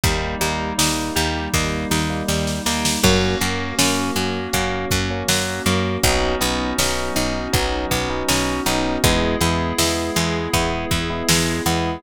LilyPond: <<
  \new Staff \with { instrumentName = "Electric Piano 1" } { \time 4/4 \key gis \minor \tempo 4 = 80 <g ais dis'>8 <g ais dis'>8 <g ais dis'>4 <g ais dis'>8. <g ais dis'>8. <g ais dis'>8 | <fis ais cis'>8 <fis ais cis'>8 <fis ais cis'>4 <fis ais cis'>8. <fis ais cis'>8. <fis ais cis'>8 | <fis b cis' dis'>8 <fis b cis' dis'>8 <fis b cis' dis'>4 <fis b cis' dis'>8. <fis b cis' dis'>8. <fis b cis' dis'>8 | <gis b e'>8 <gis b e'>8 <gis b e'>4 <gis b e'>8. <gis b e'>8. <gis b e'>8 | }
  \new Staff \with { instrumentName = "Acoustic Guitar (steel)" } { \time 4/4 \key gis \minor g8 ais8 dis'8 g8 ais8 dis'8 g8 ais8 | fis8 ais8 cis'8 fis8 ais8 cis'8 fis8 ais8 | fis8 b8 cis'8 dis'8 fis8 b8 cis'8 dis'8 | gis8 b8 e'8 gis8 b8 e'8 gis8 b8 | }
  \new Staff \with { instrumentName = "Electric Bass (finger)" } { \clef bass \time 4/4 \key gis \minor dis,8 dis,8 dis,8 dis,8 dis,8 dis,8 dis,8 dis,8 | fis,8 fis,8 fis,8 fis,8 fis,8 fis,8 fis,8 fis,8 | b,,8 b,,8 b,,8 b,,8 b,,8 b,,8 b,,8 b,,8 | e,8 e,8 e,8 e,8 e,8 e,8 e,8 e,8 | }
  \new Staff \with { instrumentName = "Pad 5 (bowed)" } { \time 4/4 \key gis \minor <g ais dis'>1 | <ais cis' fis'>1 | <b cis' dis' fis'>1 | <b e' gis'>1 | }
  \new DrumStaff \with { instrumentName = "Drums" } \drummode { \time 4/4 <hh bd>8 hh8 sn8 hh8 <bd sn>8 sn8 sn16 sn16 sn16 sn16 | <cymc bd>8 hh8 sn8 hh8 <hh bd>8 <hh bd>8 sn8 hh8 | <hh bd>8 hh8 sn8 hh8 <hh bd>8 <hh bd>8 sn8 hh8 | <hh bd>8 hh8 sn8 hh8 <hh bd>8 <hh bd>8 sn8 hh8 | }
>>